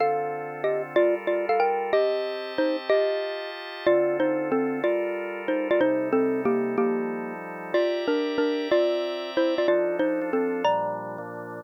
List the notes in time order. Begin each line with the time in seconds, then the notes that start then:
0.00 D3 C4 F4 A4 F5
0.64 G4 D#5
0.96 G3 F4 A4 A#4 D5
1.27 F4 D5
1.49 A4 F5
1.60 A#4 G5
1.93 C4 G4 D#5 A5
2.58 D#4 C5
2.90 F4 G4 D#5 A5
3.87 D3 C4 F4 A4 D5
4.20 D#4 C5
4.52 C4 A4
4.84 G3 F4 A4 A#4 D5
5.48 D#4 C5
5.71 F4 D5
5.81 C3 G3 D#4 A4 C5
6.13 C4 A4
6.45 A#3 G4
6.77 F3 G3 A#3 D#4 G4 A4
7.74 F4 G4 D5 E5 A#5
8.08 D4 A#4
8.38 D4 A#4
8.71 C4 F4 D5 E5 A#5
9.37 E4 C5
9.58 F4 D5
9.68 F3 D4 D#4 F4 A4 D5
9.99 D#4 C5
10.21 F3 D4 F4 A4
10.33 C4 A4
10.64 A#2 F3 G3 D4 D5 A#5
11.18 A#2 F3 A#3 D4